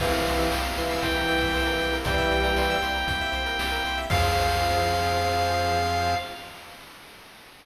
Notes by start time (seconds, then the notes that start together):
0.00 C2 C3 E3 A#3 C4 E4 G4 F5, kick, crash
0.12 A#4, closed hi-hat
0.26 C2 C5, closed hi-hat
0.38 E5, closed hi-hat
0.51 C2 G5, snare
0.64 A#5, closed hi-hat
0.76 C2 E3 C6, closed hi-hat
0.89 E6, closed hi-hat
1.01 C2 E3 G5 C6, kick, closed hi-hat
1.15 A#5, closed hi-hat
1.28 C2 G5, closed hi-hat
1.41 E5, kick, closed hi-hat
1.54 C2 C5, snare
1.66 A#4, closed hi-hat
1.79 C2 G4, closed hi-hat
1.93 A#4, closed hi-hat
2.04 C2 E3 G3 C5 G5, kick, closed hi-hat
2.18 E5, kick, closed hi-hat
2.31 C2 G5, closed hi-hat
2.44 A#5, closed hi-hat
2.56 C2 C6, snare
2.70 E6, closed hi-hat
2.82 C2 C6, closed hi-hat
2.94 A#5, closed hi-hat
3.07 C2 G5, kick, closed hi-hat
3.21 E5, closed hi-hat
3.32 C2 C5, closed hi-hat
3.46 A#4, closed hi-hat
3.59 C2 G4, snare
3.71 A#4, closed hi-hat
3.84 C2 C5, closed hi-hat
3.98 E5, closed hi-hat
4.10 F2 F3 C4 F4 G#4 C5 F5, kick, crash